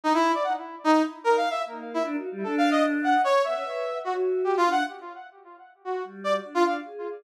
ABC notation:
X:1
M:6/4
L:1/16
Q:1/4=150
K:none
V:1 name="Brass Section"
^D E2 =d ^f z3 ^D2 z2 (3^A2 =f2 e2 z3 E z4 | (3A2 f2 ^d2 z2 ^f2 ^c2 e6 ^F z3 (3G2 =F2 ^f2 | z10 ^F2 z2 d z2 =F f z5 |]
V:2 name="Choir Aahs"
z16 ^A,4 (3D2 ^F2 G,2 | D8 z2 B, ^C B4 ^F6 D2 | z12 G,4 D4 ^G4 |]